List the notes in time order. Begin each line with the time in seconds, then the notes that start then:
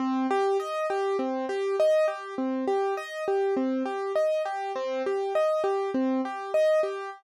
0.00 C4
0.31 G4
0.60 D#5
0.90 G4
1.19 C4
1.49 G4
1.80 D#5
2.08 G4
2.38 C4
2.67 G4
2.97 D#5
3.28 G4
3.57 C4
3.86 G4
4.15 D#5
4.45 G4
4.75 C4
5.06 G4
5.35 D#5
5.64 G4
5.94 C4
6.25 G4
6.54 D#5
6.83 G4